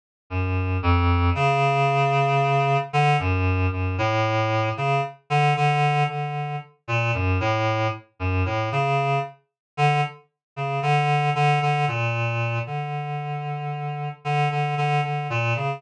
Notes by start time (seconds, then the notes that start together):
0.30 F#2
0.82 F2
1.35 C#3
2.93 D3
3.19 F#2
3.72 F#2
3.98 A2
4.77 C#3
5.30 D3
5.56 D3
6.09 D3
6.88 A#2
7.14 F#2
7.40 A2
8.20 F#2
8.46 A2
8.72 C#3
9.77 D3
10.56 C#3
10.82 D3
11.35 D3
11.62 D3
11.88 A#2
12.67 D3
14.25 D3
14.51 D3
14.77 D3
15.04 D3
15.30 A#2
15.56 C#3